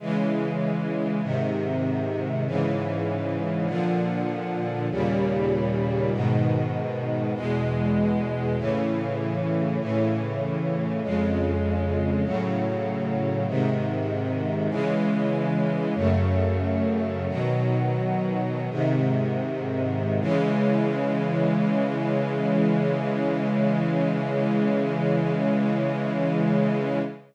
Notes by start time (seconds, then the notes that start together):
0.00 C#3 E3 G#3
1.22 G#2 C3 D#3
2.46 G#2 C#3 E3
3.66 A#2 D3 F3
4.90 D#2 A#2 C#3 G3
6.12 G#2 B2 D#3
7.35 E2 B2 G#3
8.57 A2 C#3 E3
9.80 A2 C#3 E3
11.02 F2 C#3 G#3
12.24 A2 C#3 F#3
13.47 G#2 C3 D#3
14.69 C#3 E3 G#3
15.95 F#2 C#3 A3
17.28 B2 D#3 F#3
18.70 G#2 C3 D#3
20.20 C#3 E3 G#3